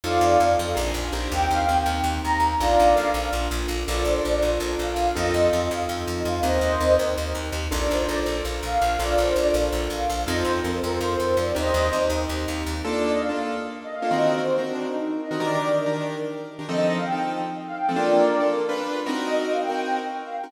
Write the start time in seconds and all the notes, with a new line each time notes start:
0.04 F2 C4 D#4 F4 A4 D5 F5
0.21 F2
0.40 F2 C4 D#4 F4 A4
0.59 F2
0.75 A#1 D4 F4 G#4 A#4
0.94 A#1
1.13 A#1 C4 D#4 G4 A#4
1.32 D#2 G5
1.50 D#2 F5
1.60 F5
1.68 D#2 C4 D#4 G4 A#4 G5
1.86 D#2
2.04 D#2
2.24 D#2 A#5
2.40 D#2
2.59 A#1 D4 F4 A4 A#4 D5 F5
2.79 A#1
2.95 A#1 D4 F4 A4 A#4
3.14 A#1
3.33 A#1
3.51 A#1
3.68 A#1
3.87 A#1 D4 F4 A4 A#4 D5
4.05 A#1 C5
4.15 C5
4.24 A#1 D4 F4 A4 A#4 D5
4.42 A#1
4.60 A#1
4.79 A#1 F5
4.96 A#1
5.15 F2 C4 D#4 F4 A4 D#5
5.25 D#5
5.34 F2
5.43 D#5
5.52 F2 C4 D#4 F4 A4 F5
5.61 D#5
5.71 F2 F5
5.89 F2
6.07 F2
6.17 D#5
6.25 F2 F5
6.43 D#2 C4 D#4 G4 A#4 C5 D#5
6.61 D#2
6.80 D#2 C4 D#4 G4 A#4
6.99 D#2
7.18 D#2
7.35 D#2
7.52 D#2
7.71 A#1 D4 F4 A4 A#4 D5
7.91 A#1 C5
8.00 C5
8.08 A#1 D4 F4 A4 A#4 D5
8.26 A#1
8.45 A#1
8.63 A#1 F5
8.82 A#1
8.99 A#1 D4 F4 A4 A#4 D5
9.17 A#1 C5
9.27 C5
9.35 A#1 D4 F4 A4 A#4 D5
9.54 A#1
9.72 A#1
9.90 A#1 F5
10.10 A#1
10.27 F2 C4 D#4 F4 A4 D#5
10.37 C5
10.45 F2
10.63 F2 C4 D#4 F4 A4 A#4
10.75 C5
10.84 F2 A#4
10.93 C5
11.01 F2
11.20 F2
11.28 C5
11.37 F2 D5
11.55 D#2 C4 D#4 G4 A#4 C5 D#5
11.74 D#2
11.92 D#2 C4 D#4 G4 A#4
12.10 D#2
12.29 D#2
12.48 D#2
12.66 D#2
12.84 A#3 D4 F4 A4 D5
12.93 D5
13.12 D#5
13.21 F5
13.29 A#3 D4 F4 A4 F5
13.84 D#5
13.95 F5
14.02 A#3 D4 F4 A4
14.11 D#3 C4 F#4 A#4 D#5
14.38 C5
14.58 D#3 C4 F#4 A#4
14.66 D4
14.86 D#4
15.21 D#5
15.31 D#3 C4 F#4 A#4
15.40 D#3 D4 G4 A#4 D5
15.86 D#3 D4 G4 A#4
16.59 D#3 D4 G4 A#4
16.68 F3 C4 D#4 A4 D#5
16.77 D#5
16.96 F5
17.05 G5
17.12 F3 C4 D#4 A4 G5
17.67 F5
17.77 G5
17.89 F3 C4 D#4 A4
17.96 A#3 D4 F4 A4 A#4 D5
18.40 A#3 D4 F4 A4
18.69 G3 D4 F4 B4
19.06 C4 D#4 F#4 A#4
19.26 D#5
19.35 D#5
19.51 F5
19.61 G5
19.69 C4 D#4 F#4 A#4 G5
20.25 F5
20.36 G5
20.44 C4 D#4 F#4 A#4